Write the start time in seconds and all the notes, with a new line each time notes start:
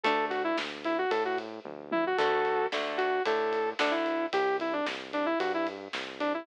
0.03 D2 A3 D4 A4, kick, ride
0.30 F#4, kick, ride
0.44 E4
0.58 D2, snare
0.84 E4, ride
0.98 F#4
1.11 A2 A4, kick, ride
1.25 F#4
1.38 kick, ride
1.65 D2, kick, high tom
1.92 E4, high tom
2.07 F#4
2.18 D2 D3 A3 F#4 A4, kick, crash
2.45 kick, ride
2.72 D2 D3 A3, snare
2.98 F#4, ride
3.25 A2 D3 A3 A4, kick, ride
3.52 kick, ride
3.79 D2 D3 A3 D4, snare
3.91 E4
4.06 ride
4.33 C2 G4, kick, ride
4.60 E4, kick, ride
4.73 D4
4.86 C2, snare
5.13 D4, ride
5.26 E4
5.40 G2 F#4, kick, ride
5.54 E4
5.67 kick, ride
5.93 C2, snare
6.20 D4, ride
6.34 E4